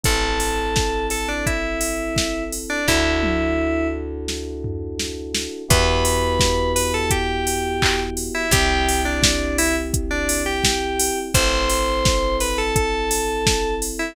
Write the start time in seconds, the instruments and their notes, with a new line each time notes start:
0.03 electric bass (finger) A1, electric piano 2 C4 E4 A4, kick, closed hi-hat
0.40 open hi-hat
0.76 kick, snare
1.10 electric piano 2 A4, open hi-hat
1.28 electric piano 2 D4
1.46 electric piano 2 E4, kick, closed hi-hat
1.81 open hi-hat
2.16 kick, snare
2.52 open hi-hat
2.70 electric piano 2 D4
2.86 electric bass (finger) D2, electric piano 2 D4 E4 F#4 A4, kick, snare
3.23 high tom
4.28 snare
4.64 floor tom
4.99 snare
5.34 snare
5.68 electric bass (finger) E2, electric piano 2 B3 E4 F#4 G4 B4, kick, closed hi-hat
6.05 open hi-hat
6.39 kick, snare
6.76 electric piano 2 B4, open hi-hat
6.94 electric piano 2 A4
7.10 electric piano 2 G4, kick, closed hi-hat
7.47 open hi-hat
7.82 kick, clap
8.17 open hi-hat
8.35 electric piano 2 E4
8.51 electric bass (finger) C2, electric piano 2 C4 E4 G4, kick, closed hi-hat
8.89 open hi-hat
9.05 electric piano 2 D4
9.23 kick, snare
9.58 electric piano 2 E4, open hi-hat
9.94 kick, closed hi-hat
10.11 electric piano 2 D4
10.29 open hi-hat
10.46 electric piano 2 G4
10.64 kick, snare
10.99 open hi-hat
11.34 electric bass (finger) A1, electric piano 2 C4 E4 A4 C5, kick, closed hi-hat
11.69 open hi-hat
12.05 kick, snare
12.40 electric piano 2 B4, open hi-hat
12.58 electric piano 2 A4
12.76 electric piano 2 A4, kick, closed hi-hat
13.11 open hi-hat
13.46 kick, snare
13.82 open hi-hat
13.99 electric piano 2 E4